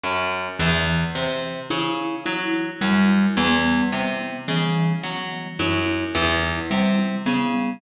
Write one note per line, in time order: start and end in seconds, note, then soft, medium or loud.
0.03 0.48 F#2 medium
0.59 1.04 E2 medium
0.59 1.04 E3 medium
1.15 1.59 C3 medium
1.70 2.15 C#3 medium
1.70 2.15 E4 medium
2.25 2.70 F#3 medium
2.25 2.70 E4 medium
2.81 3.26 F#2 medium
2.81 3.25 G3 medium
3.37 3.81 E2 medium
3.37 3.81 B3 medium
3.92 4.37 C3 medium
4.48 4.93 C#3 medium
4.48 4.93 E3 medium
5.03 5.48 F#3 medium
5.59 6.04 F#2 medium
5.59 6.04 E4 medium
6.15 6.59 E2 medium
6.15 6.60 E4 medium
6.71 7.15 C3 medium
6.71 7.15 G3 medium
7.26 7.71 C#3 medium
7.26 7.70 B3 medium